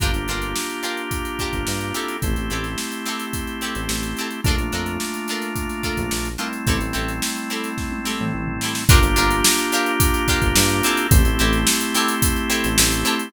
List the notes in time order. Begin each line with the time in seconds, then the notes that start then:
0.00 G1 A#3 D4 F4 G4 A#4, kick, closed hi-hat
0.14 G1, closed hi-hat
0.28 G1 D4 F4 G4 A#4, closed hi-hat
0.42 closed hi-hat
0.56 snare
0.69 closed hi-hat
0.83 D4 F4 G4 A#4, snare, closed hi-hat
0.97 closed hi-hat
1.11 kick, closed hi-hat
1.25 closed hi-hat
1.39 D4 F4 G4 A#4, kick, closed hi-hat
1.53 G1, kick, closed hi-hat
1.67 G2, snare
1.81 closed hi-hat
1.94 C4 E4 G4 A4, snare, closed hi-hat
2.08 closed hi-hat
2.22 A1 A3 C4 E4 G4, kick, closed hi-hat
2.36 A1, closed hi-hat
2.50 A1 C4 E4 G4 A4, closed hi-hat
2.64 snare, closed hi-hat
2.78 snare
2.92 closed hi-hat
3.06 C4 E4 G4 A4, snare, closed hi-hat
3.19 closed hi-hat
3.33 kick, closed hi-hat
3.47 closed hi-hat
3.61 C4 E4 G4 A4, closed hi-hat
3.75 A1, closed hi-hat
3.89 A1, snare
4.03 closed hi-hat
4.17 C4 E4 G4, closed hi-hat
4.21 A4
4.31 closed hi-hat
4.44 A#1 A3 A#3 D4 F4 A4, kick, closed hi-hat
4.49 A#4
4.58 A#1, closed hi-hat
4.72 F2 D4 F4 A4 A#4, closed hi-hat
4.86 closed hi-hat
5.00 snare
5.14 closed hi-hat
5.28 D4 F4 A4 A#4, snare, closed hi-hat
5.42 snare, closed hi-hat
5.56 kick, closed hi-hat
5.69 snare, closed hi-hat
5.83 D4 F4 A4 A#4, kick, closed hi-hat
5.97 A#1, kick, closed hi-hat
6.11 A#1, snare
6.25 closed hi-hat
6.38 G3 A3 C4 D4 E4 F4 A4 A#4, closed hi-hat
6.53 closed hi-hat
6.67 A1 C4 E4 G4 A4, kick, closed hi-hat
6.81 A1, closed hi-hat
6.93 A1 C4 E4 G4 A4, closed hi-hat
7.08 closed hi-hat
7.22 snare
7.36 closed hi-hat
7.50 C4 E4 G4 A4, snare, closed hi-hat
7.64 closed hi-hat
7.78 kick, snare
7.92 high tom
8.05 C4 E4 G4 A4, snare
8.19 A2, mid tom
8.34 A1
8.47 floor tom
8.61 C4 E4 G4, snare
8.65 A4
8.75 snare
8.89 G1 A#3 D4 F4 G4 A#4, kick, closed hi-hat
9.03 G1, closed hi-hat
9.16 G1 D4 F4 G4 A#4, closed hi-hat
9.31 closed hi-hat
9.44 snare
9.58 closed hi-hat
9.72 D4 F4 G4 A#4, snare, closed hi-hat
9.86 closed hi-hat
10.00 kick, closed hi-hat
10.14 closed hi-hat
10.28 D4 F4 G4 A#4, kick, closed hi-hat
10.42 G1, kick, closed hi-hat
10.56 G2, snare
10.69 closed hi-hat
10.83 C4 E4 G4 A4, snare, closed hi-hat
10.97 closed hi-hat
11.11 A1 A3 C4 E4 G4, kick, closed hi-hat
11.25 A1, closed hi-hat
11.39 A1 C4 E4 G4 A4, closed hi-hat
11.53 snare, closed hi-hat
11.67 snare
11.81 closed hi-hat
11.94 C4 E4 G4 A4, snare, closed hi-hat
12.08 closed hi-hat
12.22 kick, closed hi-hat
12.36 closed hi-hat
12.50 C4 E4 G4 A4, closed hi-hat
12.64 A1, closed hi-hat
12.78 A1, snare
12.92 closed hi-hat
13.05 C4 E4 G4 A4, closed hi-hat
13.19 closed hi-hat